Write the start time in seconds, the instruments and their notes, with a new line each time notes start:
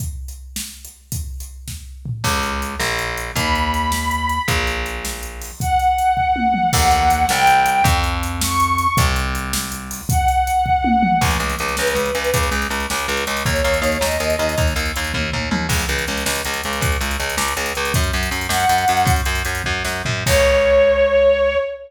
0.00 kick, closed hi-hat
0.28 closed hi-hat
0.56 snare
0.85 closed hi-hat
1.12 kick, closed hi-hat
1.40 closed hi-hat
1.68 kick, snare
2.06 floor tom
2.24 electric bass (finger) C#2, kick, crash
2.43 closed hi-hat
2.62 closed hi-hat
2.80 electric bass (finger) A#1, snare
2.99 closed hi-hat
3.18 closed hi-hat
3.36 electric bass (finger) D#2, violin B5, kick, closed hi-hat
3.55 closed hi-hat
3.74 closed hi-hat
3.92 snare
4.11 closed hi-hat
4.29 closed hi-hat
4.48 electric bass (finger) A#1, kick, closed hi-hat
4.67 closed hi-hat
4.86 closed hi-hat
5.05 snare
5.23 closed hi-hat
5.42 open hi-hat
5.60 violin F#5, kick, closed hi-hat
5.79 closed hi-hat
5.98 closed hi-hat
6.17 kick
6.36 high tom
6.54 mid tom
6.73 electric bass (finger) D#2, violin F#5, kick, crash
6.91 closed hi-hat
7.10 closed hi-hat
7.29 electric bass (finger) C2, violin G5, snare
7.47 closed hi-hat
7.66 closed hi-hat
7.84 electric bass (finger) F2, kick, closed hi-hat
8.04 closed hi-hat
8.23 closed hi-hat
8.41 violin C#6, snare
8.60 closed hi-hat
8.78 closed hi-hat
8.97 electric bass (finger) C2, kick, closed hi-hat
9.16 closed hi-hat
9.35 closed hi-hat
9.53 snare
9.72 closed hi-hat
9.91 open hi-hat
10.09 violin F#5, kick, closed hi-hat
10.28 closed hi-hat
10.47 closed hi-hat
10.66 kick
10.84 high tom
11.03 mid tom
11.21 electric bass (finger) C#2, kick, crash
11.31 closed hi-hat
11.40 electric bass (finger) C#2, closed hi-hat
11.49 closed hi-hat
11.59 electric bass (finger) C#2, closed hi-hat
11.68 closed hi-hat
11.77 electric bass (finger) C#2, violin B4, snare
11.87 closed hi-hat
11.95 electric bass (finger) C#2, closed hi-hat
12.05 closed hi-hat
12.15 electric bass (finger) C#2, closed hi-hat
12.24 closed hi-hat
12.34 electric bass (finger) C#2, kick, closed hi-hat
12.43 closed hi-hat
12.51 electric bass (finger) C#2, closed hi-hat
12.62 closed hi-hat
12.70 electric bass (finger) C#2, closed hi-hat
12.80 closed hi-hat
12.90 electric bass (finger) C#2, snare
12.99 closed hi-hat
13.08 electric bass (finger) C#2, closed hi-hat
13.17 closed hi-hat
13.27 electric bass (finger) C#2, closed hi-hat
13.37 closed hi-hat
13.45 electric bass (finger) D#2, violin C#5, kick, closed hi-hat
13.56 closed hi-hat
13.64 electric bass (finger) D#2, closed hi-hat
13.74 closed hi-hat
13.82 electric bass (finger) D#2, closed hi-hat
13.92 closed hi-hat
14.01 electric bass (finger) D#2, violin D#5, snare
14.11 closed hi-hat
14.20 electric bass (finger) D#2, closed hi-hat
14.30 closed hi-hat
14.39 electric bass (finger) D#2, closed hi-hat
14.49 closed hi-hat
14.58 electric bass (finger) D#2, kick, closed hi-hat
14.67 closed hi-hat
14.76 electric bass (finger) D#2, closed hi-hat
14.86 closed hi-hat
14.96 electric bass (finger) D#2, closed hi-hat
15.04 closed hi-hat
15.14 electric bass (finger) D#2, kick, high tom
15.32 electric bass (finger) D#2, floor tom
15.51 electric bass (finger) D#2, mid tom
15.69 electric bass (finger) C#2, kick, crash
15.79 closed hi-hat
15.89 electric bass (finger) C#2, closed hi-hat
15.98 closed hi-hat
16.08 electric bass (finger) C#2, closed hi-hat
16.17 closed hi-hat
16.26 electric bass (finger) C#2, snare
16.35 closed hi-hat
16.45 electric bass (finger) C#2, closed hi-hat
16.54 closed hi-hat
16.63 electric bass (finger) C#2, closed hi-hat
16.73 closed hi-hat
16.81 electric bass (finger) C#2, kick, closed hi-hat
16.92 closed hi-hat
17.01 electric bass (finger) C#2, closed hi-hat
17.11 closed hi-hat
17.20 electric bass (finger) C#2, closed hi-hat
17.30 closed hi-hat
17.37 electric bass (finger) C#2, snare
17.48 closed hi-hat
17.57 electric bass (finger) C#2, closed hi-hat
17.66 closed hi-hat
17.75 electric bass (finger) C#2, closed hi-hat
17.85 closed hi-hat
17.94 electric bass (finger) F#2, kick, closed hi-hat
18.04 closed hi-hat
18.13 electric bass (finger) F#2, closed hi-hat
18.23 closed hi-hat
18.31 electric bass (finger) F#2, closed hi-hat
18.41 closed hi-hat
18.49 electric bass (finger) F#2, violin F#5, snare
18.60 closed hi-hat
18.69 electric bass (finger) F#2, closed hi-hat
18.78 closed hi-hat
18.88 electric bass (finger) F#2, closed hi-hat
18.97 closed hi-hat
19.05 electric bass (finger) F#2, kick, closed hi-hat
19.16 closed hi-hat
19.25 electric bass (finger) F#2, closed hi-hat
19.35 closed hi-hat
19.45 electric bass (finger) F#2, closed hi-hat
19.55 closed hi-hat
19.64 electric bass (finger) F#2, kick
19.85 electric bass (finger) F#2, snare
20.05 electric bass (finger) F#2, floor tom
20.26 electric bass (finger) C#2, violin C#5, kick, crash